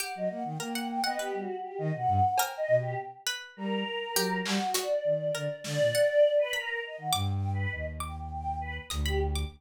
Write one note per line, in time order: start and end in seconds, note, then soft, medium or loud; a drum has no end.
0.00 0.40 G4 medium
0.00 0.13 F#5 loud
0.15 0.29 F#3 medium
0.15 0.29 D#5 medium
0.28 0.44 A#3 medium
0.28 0.42 F#5 medium
0.44 0.58 D#3 medium
0.44 0.58 G5 medium
0.60 1.00 A#3 medium
0.60 0.73 A#4 medium
0.60 0.73 G5 medium
0.74 1.02 F#5 medium
0.74 0.87 G5 medium
0.89 1.03 G5 loud
1.04 1.18 B3 medium
1.04 1.18 D#5 loud
1.04 1.17 F#5 medium
1.18 1.32 B3 medium
1.18 1.36 G4 loud
1.18 1.46 B4 soft
1.34 1.47 G3 medium
1.38 1.56 F#4 medium
1.60 1.78 G4 medium
1.78 1.92 D#3 loud
1.78 1.91 D#5 loud
1.93 2.07 B2 medium
1.93 2.33 F#5 medium
2.07 2.21 G2 loud
2.38 3.20 A#4 loud
2.38 2.56 G5 medium
2.38 cowbell loud
2.57 2.75 D#5 loud
2.68 2.95 B2 medium
2.77 2.95 G4 medium
3.27 4.07 B4 medium
3.56 3.84 G3 medium
3.56 4.37 A#4 medium
4.15 4.42 F#3 medium
4.15 4.70 G4 loud
4.45 4.59 G3 loud
4.45 4.73 F#4 medium
4.45 clap loud
4.74 4.88 F#4 medium
4.74 5.56 D5 medium
4.74 closed hi-hat medium
5.04 5.31 D#3 medium
5.35 5.48 D3 medium
5.35 5.88 A#4 medium
5.64 5.78 D3 medium
5.64 6.32 D5 loud
5.64 snare medium
5.79 5.92 A#2 medium
5.95 6.48 F#5 medium
6.38 6.52 B4 loud
6.53 6.79 A#4 medium
6.53 7.07 B5 medium
6.83 6.96 D#5 medium
6.98 7.11 D#3 medium
6.98 7.12 F#5 medium
7.13 7.67 G2 loud
7.13 7.30 G5 medium
7.13 7.39 D6 loud
7.32 7.50 G5 loud
7.53 7.70 B4 medium
7.72 8.79 D#2 medium
7.72 7.85 D#5 medium
8.00 8.16 G5 medium
8.00 8.27 D6 medium
8.18 8.29 G5 medium
8.30 8.57 G5 medium
8.60 8.74 B4 medium
8.90 9.44 D2 loud
8.90 9.03 D#6 medium
8.90 closed hi-hat medium
9.06 9.20 G4 loud
9.06 9.19 B5 medium
9.36 9.49 D6 medium